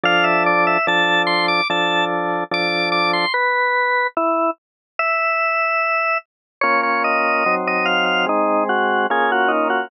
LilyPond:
<<
  \new Staff \with { instrumentName = "Drawbar Organ" } { \time 4/4 \key a \minor \tempo 4 = 73 f''16 e''16 d''16 e''16 a''8 c'''16 d'''16 a''8 r8 d'''8 d'''16 c'''16 | b'4 e'8 r8 e''4. r8 | \key bes \minor des''16 des''16 ees''8. ees''16 f''16 f''16 ees'8 ges'8 aes'16 ges'16 ees'16 ges'16 | }
  \new Staff \with { instrumentName = "Drawbar Organ" } { \time 4/4 \key a \minor <f d' a'>4 <f d' a'>4 <f d' a'>4 <f d' a'>4 | r1 | \key bes \minor <bes des' f'>4 <ges c' ees'>4 <aes c'>4 <bes des' f'>4 | }
>>